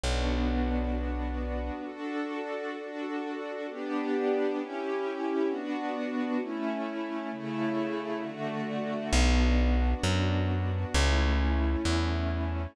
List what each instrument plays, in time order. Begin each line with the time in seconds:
0.04 electric bass (finger) B1, string ensemble 1 B3 D4 F#4
1.85 string ensemble 1 D4 F#4 A4
2.77 string ensemble 1 D4 F#4 A4
3.68 string ensemble 1 B3 D4 G4
4.57 string ensemble 1 C#4 E4 G4
5.48 string ensemble 1 B3 D4 F#4
6.39 string ensemble 1 A3 C#4 E4
7.31 string ensemble 1 C#3 A3 E4
8.21 string ensemble 1 D3 A3 F#4
9.12 electric bass (finger) B1, string ensemble 1 B3 D4 F#4
10.04 electric bass (finger) F#2
10.94 electric bass (finger) C#2, string ensemble 1 A3 C#4 E4
11.85 electric bass (finger) E2